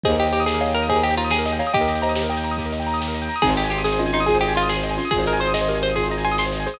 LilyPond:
<<
  \new Staff \with { instrumentName = "Pizzicato Strings" } { \time 12/8 \key aes \major \tempo 4. = 142 aes'8 g'8 g'8 aes'4 bes'8 aes'8 g'8 f'8 aes'4. | g'1 r2 | aes'8 g'8 g'8 aes'4 ees'8 aes'8 g'8 f'8 aes'4. | aes'8 bes'8 c''8 ees''4 c''8 aes'8 bes''8 aes''8 c'''4. | }
  \new Staff \with { instrumentName = "Xylophone" } { \time 12/8 \key aes \major <c'' ees''>2 <des'' f''>4 <c'' ees''>2~ <c'' ees''>8 <des'' f''>8 | <ees'' g''>4 <c'' ees''>4 <ees'' g''>4. r2 r8 | <c' ees'>2 <des' f'>4 <f' aes'>2~ <f' aes'>8 <des' f'>8 | <f' aes'>2 <g' bes'>4 <f' aes'>2~ <f' aes'>8 <aes' c''>8 | }
  \new Staff \with { instrumentName = "Acoustic Grand Piano" } { \time 12/8 \key aes \major g'16 bes'16 ees''16 g''16 bes''16 ees'''16 g'16 bes'16 ees''16 g''16 bes''16 ees'''16 g'16 bes'16 ees''16 g''16 bes''16 ees'''16 g'16 bes'16 ees''16 g''16 bes''16 ees'''16 | g'16 bes'16 ees''16 g''16 bes''16 ees'''16 g'16 bes'16 ees''16 g''16 bes''16 ees'''16 g'16 bes'16 ees''16 g''16 bes''16 ees'''16 g'16 bes'16 ees''16 g''16 bes''16 ees'''16 | aes'16 c''16 ees''16 aes''16 c'''16 ees'''16 aes'16 c''16 ees''16 aes''16 c'''16 ees'''16 aes'16 c''16 ees''16 aes''16 c'''16 ees'''16 aes'16 c''16 ees''16 aes''16 c'''16 ees'''16 | aes'16 c''16 ees''16 aes''16 c'''16 ees'''16 aes'16 c''16 ees''16 aes''16 c'''16 ees'''16 aes'16 c''16 ees''16 aes''16 c'''16 ees'''16 aes'16 c''16 ees''16 aes''16 c'''16 ees'''16 | }
  \new Staff \with { instrumentName = "Violin" } { \clef bass \time 12/8 \key aes \major ees,1. | ees,1. | aes,,1. | aes,,1. | }
  \new DrumStaff \with { instrumentName = "Drums" } \drummode { \time 12/8 <bd sn>16 sn16 sn16 sn16 sn16 sn16 sn16 sn16 sn16 sn16 sn16 sn16 <bd sn>16 sn16 sn16 sn16 sn16 sn16 sn16 sn16 sn16 sn16 sn16 sn16 | <bd sn>16 sn16 sn16 sn16 sn16 sn16 sn16 sn16 sn16 sn16 sn16 sn16 <bd sn>16 sn16 sn16 sn16 sn16 sn16 sn16 sn16 sn16 sn16 sn16 sn16 | <cymc bd>16 sn16 sn16 sn16 sn16 sn16 sn16 sn16 sn16 sn16 sn16 sn16 <bd sn>16 sn16 sn16 sn16 sn16 sn16 sn16 sn16 sn16 sn16 sn16 sn16 | <bd sn>16 sn16 sn16 sn16 sn16 sn16 sn16 sn16 sn16 sn16 sn16 sn16 <bd sn>16 sn16 sn16 sn16 sn16 sn16 sn16 sn16 sn16 sn16 sn16 sn16 | }
>>